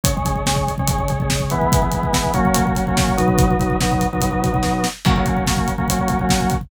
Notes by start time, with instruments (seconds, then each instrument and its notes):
0.03 drawbar organ C#3 G#3 C#4, kick, closed hi-hat
0.16 drawbar organ C#3 G#3 C#4, kick
0.25 drawbar organ C#3 G#3 C#4, kick, closed hi-hat
0.36 kick
0.46 drawbar organ C#3 G#3 C#4, kick, snare
0.56 kick
0.67 kick, closed hi-hat
0.78 drawbar organ C#3 G#3 C#4, kick
0.88 drawbar organ C#3 G#3 C#4, kick, closed hi-hat
0.99 drawbar organ C#3 G#3 C#4, kick
1.08 drawbar organ C#3 G#3 C#4, kick, closed hi-hat
1.20 drawbar organ C#3 G#3 C#4, kick
1.30 kick, snare
1.40 kick
1.50 drawbar organ E3 G#3 B3, kick, closed hi-hat
1.61 kick
1.72 kick, closed hi-hat
1.82 drawbar organ E3 G#3 B3, kick
1.91 drawbar organ E3 G#3 B3, kick, closed hi-hat
2.03 kick
2.12 drawbar organ E3 G#3 B3, kick, snare
2.24 kick
2.34 drawbar organ F#3 A#3 C#4, kick, closed hi-hat
2.45 kick
2.54 kick, closed hi-hat
2.65 drawbar organ F#3 A#3 C#4, kick
2.75 drawbar organ F#3 A#3 C#4, kick, closed hi-hat
2.87 drawbar organ F#3 A#3 C#4, kick
2.97 kick, snare
3.08 kick
3.17 drawbar organ B2 F#3 D#4, kick, closed hi-hat
3.28 kick
3.38 kick, closed hi-hat
3.47 drawbar organ B2 F#3 D#4, kick
3.59 drawbar organ B2 F#3 D#4, kick, closed hi-hat
3.70 kick
3.80 drawbar organ B2 F#3 D#4, kick, snare
3.92 kick
4.01 kick, closed hi-hat
4.13 drawbar organ B2 F#3 D#4, kick
4.21 drawbar organ B2 F#3 D#4, kick, closed hi-hat
4.31 drawbar organ B2 F#3 D#4, kick
4.41 drawbar organ B2 F#3 D#4, kick, closed hi-hat
4.52 drawbar organ B2 F#3 D#4, kick
4.63 kick, snare
4.84 snare
5.05 drawbar organ F#3 A#3 C#4, kick, crash
5.16 drawbar organ F#3 A#3 C#4, kick
5.26 drawbar organ F#3 A#3 C#4, kick, closed hi-hat
5.37 kick
5.47 drawbar organ F#3 A#3 C#4, kick, snare
5.57 kick
5.67 kick, closed hi-hat
5.78 drawbar organ F#3 A#3 C#4, kick
5.88 drawbar organ F#3 A#3 C#4, kick, closed hi-hat
5.99 drawbar organ F#3 A#3 C#4, kick
6.08 drawbar organ F#3 A#3 C#4, kick, closed hi-hat
6.19 drawbar organ F#3 A#3 C#4, kick
6.29 kick, snare
6.41 kick
6.50 kick, closed hi-hat
6.61 kick